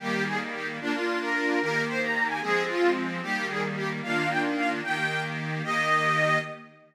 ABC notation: X:1
M:6/8
L:1/8
Q:3/8=149
K:Eb
V:1 name="Accordion"
G2 A z G z | D F2 B3 | B2 c b2 a | A2 F2 z2 |
G2 A z G z | f2 g z f z | g3 z3 | e6 |]
V:2 name="Accordion"
[E,G,B,]6 | [B,DF]6 | [E,B,G]6 | [F,A,C]6 |
[E,G,B,]6 | [E,B,DF]6 | [E,B,G]6 | [E,B,G]6 |]